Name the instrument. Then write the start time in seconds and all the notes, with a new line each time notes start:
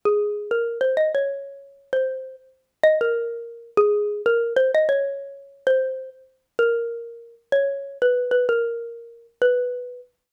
xylophone
0.05 G#4
0.51 A#4
0.81 C5
0.97 D#5
1.15 C#5
1.93 C5
2.83 D#5
3.01 A#4
3.77 G#4
4.26 A#4
4.56 C5
4.75 D#5
4.89 C#5
5.67 C5
6.59 A#4
7.52 C#5
8.02 B4
8.31 B4
8.49 A#4
9.42 B4